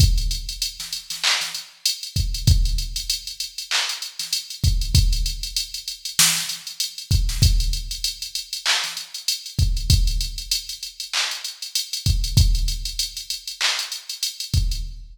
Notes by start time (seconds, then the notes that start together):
0.00 kick, closed hi-hat
0.18 closed hi-hat
0.31 closed hi-hat
0.49 closed hi-hat
0.62 closed hi-hat
0.80 snare, closed hi-hat
0.93 closed hi-hat
1.10 snare, closed hi-hat
1.24 clap
1.41 snare, closed hi-hat
1.55 closed hi-hat
1.86 closed hi-hat
2.03 closed hi-hat
2.16 kick, closed hi-hat
2.34 closed hi-hat
2.47 kick, closed hi-hat
2.65 closed hi-hat
2.78 closed hi-hat
2.96 closed hi-hat
3.10 closed hi-hat
3.27 closed hi-hat
3.40 closed hi-hat
3.58 closed hi-hat
3.71 clap
3.89 closed hi-hat
4.02 closed hi-hat
4.19 snare, closed hi-hat
4.33 closed hi-hat
4.50 closed hi-hat
4.64 kick, closed hi-hat
4.81 closed hi-hat
4.95 kick, closed hi-hat
5.13 closed hi-hat
5.26 closed hi-hat
5.43 closed hi-hat
5.56 closed hi-hat
5.74 closed hi-hat
5.88 closed hi-hat
6.05 closed hi-hat
6.19 snare
6.37 closed hi-hat
6.49 closed hi-hat
6.67 closed hi-hat
6.80 closed hi-hat
6.98 closed hi-hat
7.11 kick, closed hi-hat
7.29 snare, closed hi-hat
7.42 kick, closed hi-hat
7.60 closed hi-hat
7.73 closed hi-hat
7.91 closed hi-hat
8.04 closed hi-hat
8.22 closed hi-hat
8.35 closed hi-hat
8.53 closed hi-hat
8.66 clap
8.84 snare, closed hi-hat
8.97 closed hi-hat
9.14 closed hi-hat
9.28 closed hi-hat
9.46 closed hi-hat
9.59 kick, closed hi-hat
9.77 closed hi-hat
9.90 kick, closed hi-hat
10.07 closed hi-hat
10.21 closed hi-hat
10.38 closed hi-hat
10.51 closed hi-hat
10.69 closed hi-hat
10.83 closed hi-hat
11.00 closed hi-hat
11.13 clap
11.31 closed hi-hat
11.44 closed hi-hat
11.62 closed hi-hat
11.75 closed hi-hat
11.93 closed hi-hat
12.06 kick, closed hi-hat
12.24 closed hi-hat
12.37 kick, closed hi-hat
12.55 closed hi-hat
12.68 closed hi-hat
12.85 closed hi-hat
12.99 closed hi-hat
13.17 closed hi-hat
13.30 closed hi-hat
13.47 closed hi-hat
13.61 clap
13.79 closed hi-hat
13.92 closed hi-hat
14.09 closed hi-hat
14.23 closed hi-hat
14.40 closed hi-hat
14.54 kick, closed hi-hat
14.71 closed hi-hat